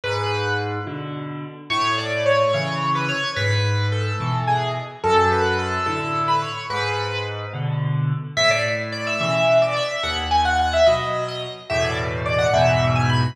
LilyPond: <<
  \new Staff \with { instrumentName = "Acoustic Grand Piano" } { \time 6/8 \key a \major \tempo 4. = 72 b'4 r2 | cis''8 d''8 cis''8 cis''8. b'16 cis''8 | b'4 a'4 gis'8 r8 | a'8 b'8 a'8 a'8. b'16 cis''8 |
b'4 r2 | e''16 d''16 r8 d''16 e''16 e''8. d''16 e''8 | fis''16 r16 gis''16 fis''16 fis''16 e''16 dis''8. dis''16 r8 | e''16 d''16 r8 d''16 fis''16 e''8. gis''16 b''8 | }
  \new Staff \with { instrumentName = "Acoustic Grand Piano" } { \clef bass \time 6/8 \key a \major gis,4. <b, d>4. | a,4. <cis e>4. | gis,4. <b, e>4. | fis,4. <a, d>4. |
gis,4. <b, d>4. | a,4. <b, cis e>4. | dis,4. <b, fis>4. | <e, a, b,>4. <e, gis, b,>4. | }
>>